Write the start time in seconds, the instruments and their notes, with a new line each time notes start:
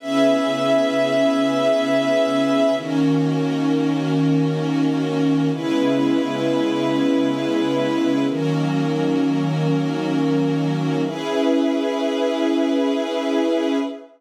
0.00 pad 5 (bowed) C#3 B3 E4 G#4, string ensemble 1 C#4 G#4 B4 E5
2.75 pad 5 (bowed) D#3 A#3 C#4 F#4, string ensemble 1 D#3 C#4 F#4 A#4
5.51 pad 5 (bowed) C#3 G#3 B3 E4, string ensemble 1 C#4 E4 G#4 B4
8.28 string ensemble 1 D#3 C#4 F#4 A#4, pad 5 (bowed) D#3 F#3 A#3 C#4
11.03 string ensemble 1 C#4 E4 G#4 B4, pad 5 (bowed) C#4 G#4 B4 E5